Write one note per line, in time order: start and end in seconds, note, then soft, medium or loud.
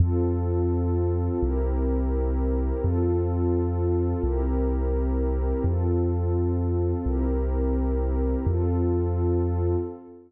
0.00 1.29 F2 medium
0.00 1.40 C4 medium
0.00 1.40 F4 medium
0.00 1.40 A4 medium
1.41 2.72 C2 medium
1.41 2.81 C4 medium
1.41 2.81 E4 medium
1.41 2.81 G4 medium
1.41 2.81 A#4 medium
2.82 4.14 F2 medium
2.82 4.22 C4 loud
2.82 4.22 F4 loud
2.82 4.22 A4 loud
4.23 5.53 C2 medium
4.23 5.63 C4 medium
4.23 5.63 E4 medium
4.23 5.63 G4 loud
4.23 5.63 A#4 loud
5.64 6.94 F2 medium
5.64 7.04 C4 medium
5.64 7.04 F4 medium
5.64 7.04 A4 medium
7.06 8.36 C2 medium
7.06 8.46 C4 loud
7.06 8.46 E4 medium
7.06 8.46 G4 loud
7.06 8.46 A#4 loud
8.46 9.76 F2 loud
8.46 9.76 C4 medium
8.46 9.76 F4 loud
8.46 9.76 A4 loud